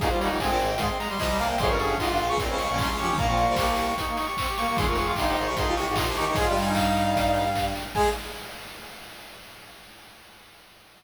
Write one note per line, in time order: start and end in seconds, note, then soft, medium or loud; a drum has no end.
0.00 0.08 D#1 loud
0.00 0.08 D#2 loud
0.00 0.09 D#4 loud
0.00 0.10 G#4 medium
0.00 kick loud
0.00 closed hi-hat loud
0.10 0.29 G3 medium
0.10 0.19 F4 medium
0.10 0.19 C5 medium
0.20 0.29 D#1 medium
0.20 0.29 D#2 medium
0.20 0.39 D#4 medium
0.20 0.36 C#5 medium
0.20 open hi-hat loud
0.29 0.38 F1 medium
0.29 0.38 F2 medium
0.29 0.41 G3 medium
0.39 0.48 G1 medium
0.39 0.48 G2 medium
0.39 0.50 G#3 medium
0.39 0.73 C4 loud
0.39 0.68 G#5 medium
0.39 kick loud
0.39 clap loud
0.49 0.58 A#1 medium
0.49 0.58 A#2 medium
0.49 0.59 C4 medium
0.58 0.75 G#1 medium
0.58 0.75 G#2 medium
0.58 open hi-hat loud
0.70 0.79 G5 medium
0.78 0.87 G#1 medium
0.78 0.87 G#2 medium
0.78 1.07 G#3 medium
0.78 0.97 C6 medium
0.78 kick loud
0.78 closed hi-hat loud
0.88 0.98 C4 loud
0.99 1.09 A#5 medium
0.99 open hi-hat loud
1.09 1.18 G3 medium
1.09 1.19 C6 medium
1.17 1.56 C2 medium
1.17 1.56 C3 medium
1.17 1.28 F3 medium
1.17 1.39 D#5 medium
1.17 kick loud
1.17 clap loud
1.28 1.38 G3 medium
1.38 1.48 A#3 loud
1.38 1.55 A#3 medium
1.38 1.49 F5 medium
1.38 open hi-hat loud
1.48 1.58 A#3 loud
1.48 1.59 G5 medium
1.58 1.68 F1 loud
1.58 1.68 F2 loud
1.58 1.69 G#4 loud
1.58 1.68 C6 medium
1.58 kick loud
1.58 closed hi-hat loud
1.68 1.95 G1 medium
1.68 1.95 G2 medium
1.68 1.87 C#4 medium
1.68 1.78 A#4 loud
1.68 1.78 C#6 medium
1.79 1.95 G#4 loud
1.79 1.95 C#6 medium
1.79 open hi-hat medium
1.89 1.98 C#4 medium
1.98 2.08 G#1 medium
1.98 2.08 G#2 medium
1.98 2.09 D#4 medium
1.98 2.33 F4 medium
1.98 2.24 C6 medium
1.98 kick medium
1.98 clap loud
2.08 2.18 G1 medium
2.08 2.18 G2 medium
2.08 2.18 G4 medium
2.17 2.28 A#1 medium
2.17 2.28 A#2 medium
2.17 open hi-hat medium
2.28 2.37 C#2 medium
2.28 2.37 C#3 loud
2.28 2.38 C#6 medium
2.38 2.48 A#1 medium
2.38 2.48 A#2 medium
2.38 2.64 C4 medium
2.38 2.58 C6 medium
2.38 kick loud
2.38 closed hi-hat loud
2.48 2.58 C#2 medium
2.48 2.58 C#3 loud
2.48 2.57 C#4 medium
2.58 2.68 C#2 medium
2.58 2.68 C#3 medium
2.58 2.68 C#6 medium
2.58 open hi-hat loud
2.68 2.78 A#1 medium
2.68 2.78 A#2 medium
2.68 2.78 C#4 medium
2.68 2.78 C#6 medium
2.78 2.89 C2 medium
2.78 2.89 C3 medium
2.78 2.88 C#4 medium
2.78 2.96 C6 medium
2.78 kick loud
2.78 clap loud
2.88 2.99 C#2 medium
2.88 2.99 C#3 medium
2.88 2.98 C#4 medium
2.98 3.09 F2 medium
2.98 3.09 F3 medium
2.98 3.07 C#4 loud
2.98 3.14 G4 medium
2.98 3.07 C#6 medium
2.98 open hi-hat medium
3.08 3.18 D#2 medium
3.08 3.18 D#3 medium
3.08 3.17 C#4 loud
3.08 3.17 C#6 medium
3.17 3.45 A#1 medium
3.17 3.45 A#2 medium
3.17 3.27 A#3 loud
3.17 3.27 A#5 medium
3.17 kick loud
3.17 closed hi-hat loud
3.28 3.37 C4 loud
3.28 3.44 F4 medium
3.28 3.37 C#6 medium
3.37 3.56 A#3 loud
3.37 3.55 C#6 medium
3.37 open hi-hat medium
3.47 3.93 C2 medium
3.47 3.93 C3 medium
3.47 3.57 F4 medium
3.56 3.93 A#3 medium
3.56 3.66 G4 medium
3.56 3.86 C#6 medium
3.56 kick loud
3.56 clap loud
3.67 3.76 G4 medium
3.76 open hi-hat loud
3.87 3.97 C#6 medium
3.98 4.26 D#4 medium
3.98 4.17 C#6 medium
3.98 kick medium
3.98 closed hi-hat loud
4.08 4.17 A#3 medium
4.17 4.26 C#6 medium
4.17 open hi-hat loud
4.26 4.36 G4 medium
4.26 4.36 C#6 medium
4.37 4.47 C4 medium
4.37 4.53 C#6 medium
4.37 kick loud
4.37 clap loud
4.48 4.57 G4 medium
4.57 4.67 A#3 loud
4.57 4.77 G4 medium
4.57 4.66 C#6 medium
4.57 open hi-hat loud
4.67 4.77 A#3 loud
4.67 4.76 C#6 medium
4.76 4.86 D#1 medium
4.76 4.86 D#2 loud
4.76 4.86 G#4 loud
4.76 4.86 C6 medium
4.76 kick loud
4.76 closed hi-hat loud
4.86 5.12 F1 medium
4.86 5.12 F2 medium
4.86 5.02 F4 medium
4.86 4.97 A#4 loud
4.86 4.96 C#6 medium
4.95 5.13 G#4 medium
4.95 5.13 C#6 medium
4.95 open hi-hat loud
5.06 5.16 F4 medium
5.15 5.25 G1 medium
5.15 5.25 G2 medium
5.15 5.49 D#4 loud
5.15 5.25 G4 medium
5.15 5.44 C6 medium
5.15 kick loud
5.15 clap loud
5.25 5.36 F1 medium
5.25 5.36 F2 medium
5.25 5.35 G4 medium
5.36 5.46 G#1 medium
5.36 5.46 G#2 medium
5.36 open hi-hat medium
5.46 5.55 C2 medium
5.46 5.55 C3 medium
5.46 5.56 C#6 medium
5.55 5.65 G#1 medium
5.55 5.65 G#2 loud
5.55 5.81 D#4 medium
5.55 5.73 C6 medium
5.55 kick loud
5.55 closed hi-hat loud
5.66 5.75 C2 medium
5.66 5.75 C3 medium
5.66 5.76 F4 loud
5.76 5.86 C2 medium
5.76 5.86 C3 medium
5.76 5.86 C#6 medium
5.76 open hi-hat loud
5.86 5.97 G#1 medium
5.86 5.97 G#2 medium
5.86 5.95 G4 medium
5.86 5.96 C#6 medium
5.96 6.06 A#1 medium
5.96 6.06 A#2 medium
5.96 6.05 D#4 medium
5.96 6.12 C6 medium
5.96 kick loud
5.96 clap loud
6.06 6.15 C2 medium
6.06 6.15 C3 medium
6.06 6.15 G4 medium
6.15 6.26 D#2 medium
6.15 6.26 D#3 medium
6.15 6.25 D#4 loud
6.15 6.34 G4 medium
6.15 6.25 C#6 medium
6.15 open hi-hat loud
6.26 6.37 C#2 medium
6.26 6.37 C#3 medium
6.26 6.36 D#4 medium
6.26 6.36 C#6 medium
6.35 6.46 G#2 medium
6.35 6.46 G#3 medium
6.35 6.73 F4 medium
6.35 6.46 G#4 loud
6.35 6.45 G#5 medium
6.35 kick loud
6.35 closed hi-hat loud
6.47 6.55 G2 medium
6.47 6.55 G3 medium
6.47 6.56 G4 medium
6.56 7.73 G2 medium
6.56 7.73 G3 medium
6.56 open hi-hat loud
6.65 7.44 D#4 medium
6.65 6.75 G#5 medium
6.75 7.65 F5 medium
6.75 kick loud
6.75 clap loud
6.96 open hi-hat medium
7.16 kick loud
7.16 closed hi-hat loud
7.34 open hi-hat loud
7.55 kick medium
7.55 clap loud
7.75 open hi-hat loud
7.95 8.09 G#3 loud
7.95 8.10 G#3 loud
7.95 8.09 G#4 loud
7.95 8.09 G#5 loud
7.95 kick loud
7.95 crash loud